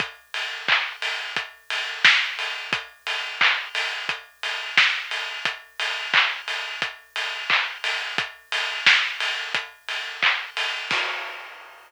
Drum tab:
CC |--------|--------|--------|--------|
HH |xo-oxo-o|xo-oxo-o|xo-oxo-o|xo-oxo-o|
CP |--x-----|--x-----|--x---x-|------x-|
SD |------o-|------o-|--------|--o-----|
BD |o-o-o-o-|o-o-o-o-|o-o-o-o-|o-o-o-o-|

CC |x-------|
HH |--------|
CP |--------|
SD |--------|
BD |o-------|